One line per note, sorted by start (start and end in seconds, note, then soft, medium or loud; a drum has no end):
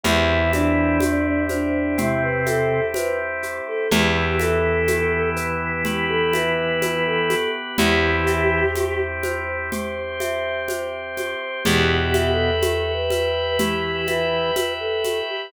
0.03 3.60 E2 loud
0.03 1.00 E3 medium
0.03 3.88 C4 medium
0.03 0.51 E4 medium
0.03 3.88 E4 medium
0.03 1.00 E4 loud
0.03 1.01 G4 loud
0.03 3.88 G4 medium
0.03 low conga medium
0.03 shaker medium
0.53 1.43 D4 medium
0.53 2.46 E5 medium
0.53 high conga medium
0.53 shaker medium
1.00 1.97 G4 medium
1.00 high conga medium
1.00 shaker medium
1.49 1.96 D4 medium
1.49 2.94 C5 medium
1.49 high conga medium
1.49 shaker medium
1.98 2.80 C3 medium
1.98 2.80 C4 loud
1.98 2.22 E4 medium
1.98 3.43 G4 medium
1.98 low conga medium
1.98 shaker medium
2.22 2.45 B4 medium
2.46 2.86 A4 medium
2.46 3.84 E5 medium
2.46 high conga medium
2.46 shaker medium
2.94 3.18 B4 medium
2.94 3.87 C5 medium
2.94 high conga medium
2.94 shaker medium
3.43 3.89 G4 medium
3.43 shaker medium
3.68 3.91 A4 medium
3.91 7.48 E2 medium
3.91 7.35 E3 medium
3.91 5.84 B3 medium
3.91 5.84 E4 medium
3.91 7.35 E4 medium
3.91 4.33 G4 medium
3.91 4.88 G4 loud
3.91 5.84 G4 medium
3.91 low conga loud
3.91 shaker medium
4.40 5.29 A4 medium
4.40 6.33 E5 medium
4.40 high conga medium
4.40 shaker medium
4.88 5.85 G4 medium
4.88 high conga medium
4.88 shaker medium
5.36 6.81 B4 medium
5.36 shaker medium
5.85 7.77 B3 medium
5.85 7.30 G4 medium
5.85 7.77 G4 loud
5.85 6.08 G4 medium
5.85 7.77 B4 medium
5.85 low conga medium
5.85 shaker medium
6.09 6.32 A4 medium
6.33 6.79 B4 medium
6.33 7.71 E5 medium
6.33 high conga medium
6.33 shaker medium
6.81 7.04 B4 medium
6.81 7.74 B4 medium
6.81 high conga medium
6.81 shaker medium
7.06 7.50 A4 medium
7.30 7.76 G4 medium
7.30 high conga medium
7.30 shaker medium
7.78 11.35 E2 medium
7.78 8.65 E3 medium
7.78 9.70 C4 medium
7.78 8.65 E4 loud
7.78 9.70 E4 medium
7.78 9.00 G4 medium
7.78 8.75 G4 loud
7.78 9.70 G4 medium
7.78 low conga loud
7.78 shaker medium
8.27 10.20 E5 loud
8.27 shaker medium
8.75 9.72 G4 medium
8.75 high conga medium
8.75 shaker medium
9.23 10.69 C5 medium
9.23 high conga medium
9.23 shaker medium
9.72 11.64 C4 medium
9.72 11.64 G4 medium
9.72 11.17 G4 loud
9.72 11.64 C5 medium
9.72 low conga medium
9.72 shaker medium
10.20 11.58 E5 medium
10.20 high conga medium
10.20 shaker medium
10.68 11.61 C5 medium
10.68 high conga medium
10.68 shaker medium
11.17 11.64 G4 medium
11.17 high conga medium
11.17 shaker medium
11.65 15.22 E2 loud
11.65 12.51 B2 medium
11.65 12.51 B3 medium
11.65 12.28 G4 medium
11.65 12.62 G4 loud
11.65 15.49 B4 loud
11.65 15.49 E5 medium
11.65 15.49 G5 medium
11.65 low conga medium
11.65 shaker medium
12.14 14.07 E5 medium
12.14 high conga medium
12.14 shaker medium
12.31 12.92 A4 medium
12.62 13.59 G4 medium
12.62 high conga medium
12.62 shaker medium
12.94 13.57 B4 medium
13.10 14.56 B4 loud
13.10 high conga medium
13.10 shaker medium
13.58 14.51 E3 medium
13.58 14.51 E4 medium
13.58 14.04 G4 medium
13.58 15.04 G4 medium
13.58 low conga medium
13.58 shaker medium
14.07 14.74 B4 medium
14.07 15.45 E5 medium
14.07 high conga medium
14.07 shaker medium
14.56 15.48 B4 medium
14.56 high conga medium
14.56 shaker medium
14.80 15.19 A4 medium
15.04 15.50 G4 medium
15.04 high conga medium
15.04 shaker medium
15.30 15.52 G4 medium